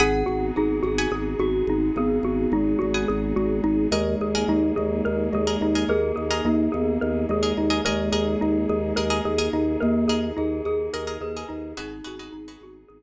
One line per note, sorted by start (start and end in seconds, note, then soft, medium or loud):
0.00 0.24 G#1 loud
0.00 3.88 B3 medium
0.00 3.88 D#4 medium
0.00 3.88 F#4 medium
0.00 3.88 G#4 medium
0.00 0.26 G#4 loud
0.00 0.44 F#5 medium
0.00 0.45 F#5 medium
0.00 0.44 G#5 medium
0.00 0.44 B5 medium
0.00 0.44 D#6 medium
0.26 0.52 G#1 medium
0.26 0.52 F#4 medium
0.56 0.81 G#1 medium
0.56 0.83 D#4 medium
0.56 0.79 G#4 medium
0.83 1.07 G#1 medium
0.83 1.08 F#4 medium
0.83 1.34 G#4 medium
0.98 1.43 F#5 medium
0.98 1.43 G#5 medium
0.98 1.43 B5 medium
0.98 1.43 D#6 medium
1.12 1.35 G#1 medium
1.12 1.38 G#4 medium
1.39 1.63 G#1 medium
1.39 1.65 F#4 medium
1.39 1.85 F#4 medium
1.67 1.91 G#1 loud
1.67 1.95 D#4 medium
1.96 2.20 G#1 medium
1.96 2.52 B3 medium
1.96 2.23 G#4 loud
2.23 2.47 G#1 medium
2.23 2.50 F#4 medium
2.52 2.76 G#1 medium
2.52 2.80 G#3 medium
2.52 2.79 D#4 medium
2.79 3.05 G#1 medium
2.79 3.32 G#3 medium
2.79 3.05 F#4 medium
2.94 3.39 F#5 medium
2.94 3.39 G#5 medium
2.94 3.39 B5 medium
2.94 3.39 D#6 medium
3.08 3.33 G#1 loud
3.08 3.34 G#4 medium
3.36 3.61 G#1 medium
3.36 3.86 G#3 medium
3.36 3.62 F#4 medium
3.64 3.88 G#1 medium
3.64 3.90 D#4 medium
3.91 4.15 D#2 loud
3.91 4.45 G#3 medium
3.91 7.81 A#3 medium
3.91 7.81 D#4 medium
3.91 4.26 G#4 medium
3.91 7.81 G#4 medium
3.91 4.26 A#4 medium
3.91 4.18 A#4 medium
3.91 4.26 D#5 medium
4.21 4.45 D#2 medium
4.21 4.47 G#4 medium
4.35 4.80 G#4 medium
4.35 4.80 A#4 medium
4.35 4.80 D#5 medium
4.48 4.72 D#2 medium
4.48 4.73 G#3 medium
4.48 4.75 D#4 loud
4.76 5.02 D#2 medium
4.76 5.27 G#3 medium
4.76 5.02 G#4 medium
5.05 5.30 D#2 medium
5.05 5.31 A#4 medium
5.32 5.57 D#2 medium
5.32 5.86 G#3 medium
5.32 5.60 G#4 medium
5.47 5.70 G#4 medium
5.47 5.70 A#4 medium
5.47 5.70 D#5 medium
5.61 5.85 D#2 medium
5.61 5.88 D#4 medium
5.75 6.20 G#4 medium
5.75 6.20 A#4 medium
5.75 6.20 D#5 medium
5.88 6.12 D#2 medium
5.88 6.42 G#4 loud
5.88 6.15 A#4 loud
6.16 6.41 D#2 medium
6.16 6.41 G#4 medium
6.31 6.75 G#4 medium
6.31 6.75 A#4 medium
6.31 6.75 D#5 medium
6.45 6.68 D#2 medium
6.45 6.69 A#3 medium
6.45 6.72 D#4 medium
6.72 6.98 D#2 medium
6.72 7.21 B3 medium
6.72 6.98 G#4 medium
7.01 7.26 D#2 medium
7.01 7.27 A#4 medium
7.29 7.53 D#2 medium
7.29 7.81 G#3 medium
7.29 7.57 G#4 medium
7.43 7.65 G#4 medium
7.43 7.65 A#4 medium
7.43 7.65 D#5 medium
7.57 7.81 D#2 medium
7.57 7.83 D#4 medium
7.70 7.81 G#4 medium
7.70 7.81 A#4 medium
7.70 7.81 D#5 medium
7.85 8.10 D#2 medium
7.85 9.22 G#3 loud
7.85 11.73 A#3 medium
7.85 11.73 D#4 medium
7.85 11.73 G#4 loud
7.85 8.08 G#4 medium
7.85 8.11 A#4 medium
7.85 8.08 A#4 medium
7.85 8.08 D#5 medium
8.12 8.36 D#2 medium
8.12 8.38 G#4 medium
8.12 8.57 G#4 medium
8.12 8.57 A#4 medium
8.12 8.57 D#5 medium
8.41 8.66 D#2 medium
8.41 8.67 D#4 medium
8.69 8.93 D#2 medium
8.69 8.95 G#4 medium
8.96 9.21 D#2 medium
8.96 9.08 G#4 medium
8.96 9.22 A#4 loud
8.96 9.08 A#4 medium
8.96 9.08 D#5 medium
9.10 9.33 G#4 medium
9.10 9.33 A#4 medium
9.10 9.33 D#5 medium
9.25 9.49 D#2 medium
9.25 9.51 G#4 medium
9.38 9.83 G#4 medium
9.38 9.83 A#4 medium
9.38 9.83 D#5 medium
9.53 9.77 D#2 medium
9.53 9.79 D#4 medium
9.80 10.06 D#2 loud
9.80 10.27 A#3 loud
9.80 10.06 A#4 medium
10.08 10.32 D#2 medium
10.08 10.34 G#4 medium
10.08 10.54 G#4 medium
10.08 10.54 A#4 medium
10.08 10.54 D#5 medium
10.37 10.62 D#2 medium
10.37 10.62 D#4 medium
10.37 10.63 G#4 medium
10.65 10.89 D#2 medium
10.65 11.12 G#4 loud
10.65 10.92 G#4 medium
10.93 11.18 D#2 medium
10.93 11.05 G#4 medium
10.93 11.19 A#4 loud
10.93 11.05 A#4 medium
10.93 11.05 D#5 medium
11.07 11.30 G#4 medium
11.07 11.30 A#4 medium
11.07 11.30 D#5 medium
11.21 11.45 D#2 medium
11.21 11.47 G#4 medium
11.21 11.70 B4 medium
11.37 11.70 G#4 medium
11.37 11.70 A#4 medium
11.37 11.70 D#5 medium
11.49 11.74 D#2 medium
11.49 11.74 D#4 medium
11.77 12.02 G#1 loud
11.77 13.03 B3 medium
11.77 12.79 D#4 loud
11.77 13.03 D#4 medium
11.77 12.00 F#4 medium
11.77 13.03 F#4 medium
11.77 12.00 G#4 medium
11.77 13.03 G#4 loud
11.77 12.04 G#4 loud
11.77 12.00 B4 medium
11.77 12.00 D#5 medium
12.04 12.30 G#1 medium
12.04 12.16 F#4 medium
12.04 12.33 F#4 medium
12.04 12.16 G#4 medium
12.04 12.16 B4 medium
12.04 12.16 D#5 medium
12.19 12.42 F#4 medium
12.19 12.42 G#4 medium
12.19 12.42 B4 medium
12.19 12.42 D#5 medium
12.32 12.57 G#1 medium
12.32 12.58 D#4 medium
12.48 12.93 F#4 medium
12.48 12.93 G#4 medium
12.48 12.93 B4 medium
12.48 12.93 D#5 medium
12.61 12.85 G#1 medium
12.61 12.89 F#4 medium
12.88 13.03 G#1 medium
12.88 13.03 G#4 medium